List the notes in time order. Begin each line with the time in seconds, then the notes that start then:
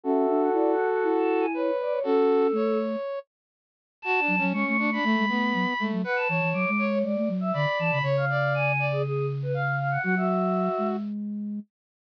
0.03 C#4 F#4 A4 E5
0.29 D4
0.40 F#5
0.53 E4 D5
0.72 F#5
0.88 F#5
1.03 E4
1.18 A5
1.40 G#5
1.54 B4 C#5
1.81 D5
1.91 C#5
2.03 C#4 F#4 A4
2.52 A3 C#5
4.02 F#4 A5
4.20 D4
4.28 F#3
4.38 F#3 C#4
4.52 G#3 C#4 C#6
4.66 A3 C#6
4.78 D4 C#6
4.92 D4 B5
5.04 A3
5.19 G#3
5.29 A3 B3
5.54 F#3
5.79 G#3 A3
5.92 F#3
6.04 B4 F#5
6.16 A5
6.29 E3 C#5
6.41 E3
6.53 F#3 D6
6.68 G#3
6.78 C#5
6.90 C#5
7.04 G#3 D5
7.17 A3
7.29 F#3
7.41 E5
7.53 D3 D5 B5
7.79 E3 A5
7.91 C#3 B5
8.02 C#3 C#5
8.17 F5
8.30 D5
8.54 G#5
8.79 D5
8.92 G#4
9.03 G#4
9.42 B4
9.54 F5
9.79 F5
9.91 F#5
10.03 F#3 F#4 F#5
10.16 F#4 E5
10.78 G#3